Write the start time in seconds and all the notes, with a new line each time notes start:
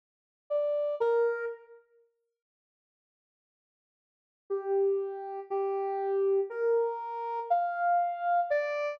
0.50 D5
1.00 A#4
4.50 G4
5.50 G4
6.50 A#4
7.50 F5
8.50 D5